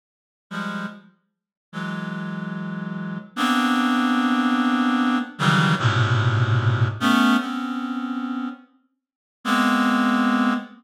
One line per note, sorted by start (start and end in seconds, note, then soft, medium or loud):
0.50 0.86 F3 medium
0.50 0.86 G3 medium
0.50 0.86 G#3 medium
1.72 3.18 E3 soft
1.72 3.18 F#3 soft
1.72 3.18 G#3 soft
3.36 5.19 A#3 medium
3.36 5.19 B3 medium
3.36 5.19 C4 medium
3.36 5.19 D4 medium
5.39 5.75 C#3 medium
5.39 5.75 D#3 medium
5.39 5.75 E3 medium
5.39 5.75 F#3 medium
5.39 5.75 G3 medium
5.79 6.88 G#2 medium
5.79 6.88 A2 medium
5.79 6.88 A#2 medium
5.79 6.88 B2 medium
5.79 6.88 C3 medium
7.00 7.37 A3 loud
7.00 7.37 B3 loud
7.00 7.37 C#4 loud
7.40 8.49 B3 medium
7.40 8.49 C4 medium
7.40 8.49 C#4 medium
9.44 10.54 G#3 medium
9.44 10.54 A#3 medium
9.44 10.54 B3 medium
9.44 10.54 C4 medium